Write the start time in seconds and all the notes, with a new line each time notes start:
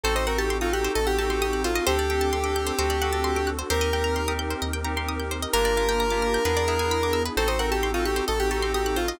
0.04 A1 C4 D#4 F#4 A4 C5
0.15 C5 D#5
0.27 C4 D#4 F#4 A4 A#4 F#5
0.38 G4 A5
0.50 C6
0.61 C4 D#4 F4 F#4 A4 D#6
0.73 G4 F#6
0.84 C5
0.95 A1 A4 D#5
1.07 G4 F#5
1.18 C4 D#4 F#4 G4 A4 A5
1.30 C4 D#4 F#4 A4 C6
1.41 G4 D#6
1.53 F#6
1.64 F4 C5
1.75 D#5
1.87 D2 C4 D4 G4 A4 C5
1.99 D5
2.10 C4 D4 G4 A4 G5
2.21 A5
2.33 C6
2.44 C4 D4 G4 A4 D6
2.56 G6
2.67 C5
2.78 D2 C4 D4 F#4 A4 C5
2.90 D5
3.02 C4 D4 F#4 A4 F#5
3.13 C4 D4 F#4 A4 A5
3.24 C6
3.36 D6
3.47 F#6
3.59 C5
3.70 D#2 C4 D#4 G4 A#4 C5
3.81 D#5
3.93 C4 D#4 G4 A#4 G5
4.04 A#5
4.16 C6
4.28 C4 D#4 G4 A#4 D#6
4.39 G6
4.50 C5
4.62 D#2 D#5
4.73 G5
4.84 C4 D#4 G4 A#4 A#5
4.96 C4 D#4 G4 A#4 C6
5.08 D#6
5.20 G6
5.31 C5
5.42 D#5
5.53 G1 A#3 D4 F4 G4 A#4
5.65 D5
5.76 A#3 D4 F4 G4 F5
5.89 G5
6.00 A#5
6.10 A#3 D4 F4 G4 D6
6.22 F6
6.34 G6
6.45 E2 B3 D4 E4 G#4 B4
6.57 D5
6.68 B3 D4 E4 G#4 E5
6.79 B3 D4 E4 G#4 G#5
6.91 B5
7.03 D6
7.13 E6
7.25 B4
7.36 A1 C4 D#4 F#4 A4 C5
7.48 C5 D#5
7.59 C4 D#4 F#4 A4 A#4 F#5
7.71 G4 A5
7.83 C6
7.94 C4 D#4 F4 F#4 A4 D#6
8.05 G4 F#6
8.16 C5
8.28 A1 A4 D#5
8.40 G4 F#5
8.51 C4 D#4 F#4 G4 A4 A5
8.62 C4 D#4 F#4 A4 C6
8.74 G4 D#6
8.86 F#6
8.96 F4 C5
9.08 D#5